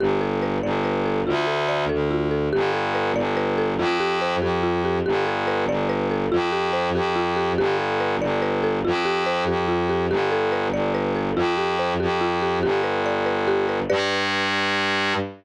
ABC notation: X:1
M:6/8
L:1/8
Q:3/8=95
K:Gmix
V:1 name="Violin" clef=bass
G,,,3 G,,,3 | D,,3 D,,3 | G,,,3 G,,,3 | F,,3 F,,3 |
G,,,3 G,,,3 | F,,3 F,,3 | G,,,3 G,,,3 | F,,3 F,,3 |
G,,,3 G,,,3 | F,,3 F,,3 | G,,,6 | G,,6 |]
V:2 name="Marimba"
G A B d B A | F A d A F A | G A B d B A | F G c G F G |
G A B d B A | F G c G F G | G A B d B A | F G c G F G |
G A B d B A | F G c G F G | G B d B G B | [GBd]6 |]